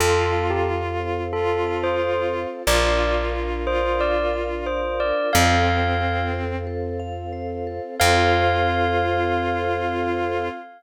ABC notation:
X:1
M:4/4
L:1/16
Q:1/4=90
K:Fmix
V:1 name="Tubular Bells"
A3 G z4 A3 c3 z2 | d3 z3 c2 d2 z2 c2 d2 | f6 z10 | f16 |]
V:2 name="Violin"
F8 F8 | F6 F6 z4 | C8 z8 | F16 |]
V:3 name="Vibraphone"
A2 f2 A2 c2 A2 f2 c2 A2 | B2 f2 B2 d2 B2 f2 d2 B2 | A2 f2 A2 c2 A2 f2 c2 A2 | [Acf]16 |]
V:4 name="Electric Bass (finger)" clef=bass
F,,16 | B,,,16 | F,,16 | F,,16 |]
V:5 name="String Ensemble 1"
[CFA]16 | [DFB]16 | [CFA]16 | [CFA]16 |]